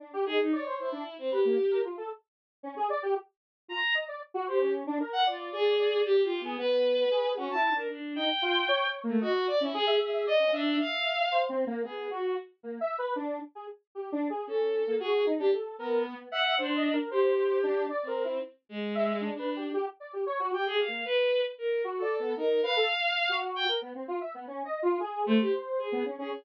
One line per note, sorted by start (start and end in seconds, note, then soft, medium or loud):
0.00 0.12 D4 medium
0.13 0.25 G4 loud
0.26 0.38 D#4 medium
0.26 0.38 G#4 loud
0.40 0.52 D#4 medium
0.52 0.76 C#5 medium
0.52 0.64 D5 medium
0.66 0.90 C5 medium
0.79 1.15 E4 medium
0.92 1.04 D4 medium
1.18 1.30 C4 medium
1.31 1.78 G4 medium
1.31 1.43 B4 medium
1.45 1.57 A#3 medium
1.71 1.83 A#4 medium
1.84 1.96 F4 medium
1.97 2.09 A4 medium
2.63 2.75 C#4 medium
2.76 2.88 G#4 loud
2.90 3.02 D5 loud
3.03 3.14 G4 loud
3.68 3.80 F4 medium
3.68 3.93 A#5 loud
3.95 4.06 D#5 medium
4.08 4.20 D5 medium
4.34 4.46 F#4 loud
4.47 4.72 G4 medium
4.47 4.59 C5 medium
4.61 4.84 C#4 medium
4.87 4.98 D4 loud
5.00 5.24 A#4 medium
5.13 5.24 F#5 loud
5.26 5.49 F4 medium
5.26 5.74 D5 medium
5.52 6.00 G#4 loud
5.79 6.14 D5 medium
6.05 6.21 G4 loud
6.18 6.42 G4 medium
6.23 6.39 F4 medium
6.40 6.56 B3 medium
6.45 6.57 G#4 medium
6.58 7.05 B3 medium
6.58 7.29 B4 loud
7.11 7.34 G#4 medium
7.37 7.49 C#4 medium
7.37 7.53 F#4 medium
7.50 7.70 E4 loud
7.50 7.74 A5 medium
7.72 7.88 D4 medium
7.72 7.88 A#4 medium
7.89 8.13 D4 medium
8.15 8.28 D#4 medium
8.15 8.87 G5 medium
8.42 8.66 F4 loud
8.68 8.84 C#5 loud
8.86 9.02 C#5 medium
9.04 9.19 A3 medium
9.04 9.19 A#3 medium
9.21 9.45 F#4 loud
9.21 9.33 D#5 medium
9.47 9.59 D5 loud
9.61 9.72 C#4 medium
9.61 9.73 E4 medium
9.73 9.97 G#4 loud
9.73 9.86 G#4 loud
9.87 10.10 E5 medium
10.00 10.23 G#4 medium
10.13 10.25 E5 medium
10.26 10.38 D5 medium
10.26 10.51 D#5 loud
10.39 10.51 C#4 medium
10.52 10.76 D4 loud
10.52 11.23 E5 medium
10.80 11.39 F5 medium
11.32 11.47 C5 medium
11.49 11.65 C4 loud
11.67 11.83 A#3 loud
11.84 12.08 B3 medium
11.84 12.07 G#4 medium
12.11 12.34 F#4 medium
12.63 12.79 A#3 medium
12.81 12.96 E5 loud
12.98 13.14 B4 loud
13.16 13.39 D4 loud
13.55 13.67 G#4 medium
13.95 14.11 G4 medium
14.12 14.28 D4 loud
14.30 14.46 G#4 medium
14.47 14.83 C#4 medium
14.47 14.95 A4 medium
14.87 14.99 A#3 medium
15.00 15.24 F#4 medium
15.00 15.23 G#4 loud
15.26 15.38 D#4 medium
15.39 15.51 D4 loud
15.39 15.51 G4 medium
15.53 15.76 A4 medium
15.78 16.14 B3 medium
15.78 16.03 A#4 medium
16.05 16.29 B3 medium
16.31 16.55 E5 loud
16.31 16.55 F#5 loud
16.58 16.94 D4 medium
16.58 16.74 C5 medium
16.75 16.91 D#5 medium
16.93 17.09 A#4 medium
17.11 17.82 G4 medium
17.11 17.58 C5 medium
17.63 17.87 D4 loud
17.90 18.05 D5 medium
18.03 18.38 C4 medium
18.07 18.23 A#4 medium
18.24 18.40 E4 medium
18.69 19.28 G#3 medium
18.95 19.18 E5 loud
19.21 19.37 D4 medium
19.34 19.70 D4 medium
19.39 19.54 B4 medium
19.56 19.72 G4 medium
19.74 19.85 G4 loud
20.00 20.12 D5 medium
20.13 20.25 G4 medium
20.26 20.38 C#5 loud
20.39 20.51 F#4 loud
20.53 20.68 G4 medium
20.53 20.65 G5 medium
20.66 20.78 G#4 loud
20.70 20.86 G4 medium
20.79 21.03 F5 medium
20.88 21.04 A#3 medium
21.05 21.41 B4 loud
21.58 21.82 A#4 medium
21.84 22.00 F#4 medium
21.97 22.33 A4 medium
22.02 22.17 D5 medium
22.19 22.35 B3 medium
22.37 22.61 D#4 medium
22.37 22.61 A#4 medium
22.63 22.75 B4 loud
22.63 23.34 F5 loud
22.76 22.88 A4 loud
23.29 23.65 F#4 loud
23.56 23.67 G5 loud
23.68 23.80 A#4 medium
23.82 23.93 B3 medium
23.95 24.07 C4 medium
24.08 24.20 F4 loud
24.21 24.33 E5 medium
24.34 24.46 B3 medium
24.47 24.63 C#4 medium
24.65 24.81 D#5 medium
24.82 24.98 F4 loud
25.00 25.24 G#4 medium
25.26 25.38 A3 loud
25.26 25.86 C5 medium
25.40 25.52 G4 medium
25.79 26.02 G#4 medium
25.92 26.04 B3 medium
26.05 26.17 C#4 medium
26.18 26.30 C#4 medium
26.18 26.30 G#4 medium